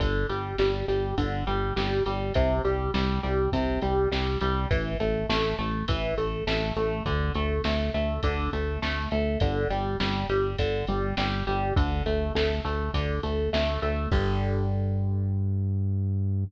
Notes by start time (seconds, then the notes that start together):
0.00 G1 D3, kick, ride
0.29 G1 G3, ride
0.58 G1 G3, snare
0.88 G1 G3, ride
1.18 G1 D3, kick, ride
1.47 G1 G3, ride
1.76 G1 G3, snare
2.06 G1 G3, ride
2.34 C2 C3, kick, ride
2.65 C2 G3, ride
2.94 C2 G3, snare
3.23 C2 G3, ride
3.52 C2 C3, kick, ride
3.82 C2 G3, ride
4.12 C2 G3, snare
4.41 C2 G3, ride
4.71 A1 E3, kick, ride
5.00 A1 A3, ride
5.29 A1 A3, snare
5.59 A1 A3, ride
5.88 A1 E3, kick, ride
6.18 A1 A3, ride
6.47 A1 A3, snare
6.76 A1 A3, ride
7.06 D2 D3, kick, ride
7.34 D2 A3, ride
7.64 D2 A3, snare
7.94 D2 A3, ride
8.23 D2 D3, kick, ride
8.53 D2 A3, ride
8.82 D2 A3, snare
9.11 D2 A3, ride
9.40 G1 D3, kick, ride
9.70 G1 G3, ride
10.00 G1 G3, snare
10.29 G1 G3, ride
10.58 G1 D3, kick, ride
10.87 G1 G3, ride
11.17 G1 G3, snare
11.47 G1 G3, ride
11.76 D2 D3, kick, ride
12.06 D2 A3, ride
12.35 D2 A3, snare
12.65 D2 A3, ride
12.94 D2 D3, kick, ride
13.23 D2 A3, ride
13.53 D2 A3, snare
13.82 D2 A3, ride
14.12 G2 D3 G3, kick, crash